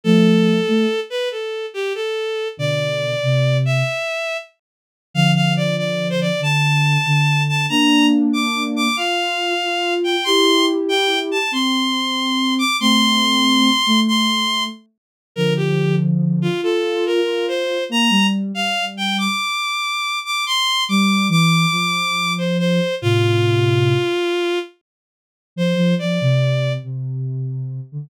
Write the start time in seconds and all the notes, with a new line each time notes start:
0.04 F3 A3 A4
0.68 A3
1.10 B4
1.31 A4
1.74 G4
1.95 A4
2.57 B2 D3 D5
3.23 C3
3.65 E5
5.14 D3 F3 F5
5.35 F5
5.56 D5
5.78 D5
6.10 C5
6.21 D5
6.39 D3 A5
7.06 D3
7.49 A5
7.69 A#3 D4 A#5
8.33 D6
8.76 D6
8.96 F4 F5
9.63 F4
10.04 G5
10.24 E4 G4 C6
10.89 G5
11.31 A5
11.51 C4 C6
12.59 D6
12.80 A3 C4 C6
13.86 A3
14.08 C6
15.36 D3 F3 A#4
15.56 G4
16.42 F4
16.61 F4 A4
17.06 A#4
17.25 F4
17.48 C5
17.89 A#3 A#5
18.10 G3
18.54 G3 F5
18.97 G5
19.18 D6
20.25 D6
20.46 C6
20.89 G3 D6
21.29 E3 D6
21.71 F3
22.38 C5
22.59 C5
23.02 A2 C3 F4
25.56 F3 C5
25.76 F3
25.99 F3 D5
26.21 C3
26.83 C3
27.92 D3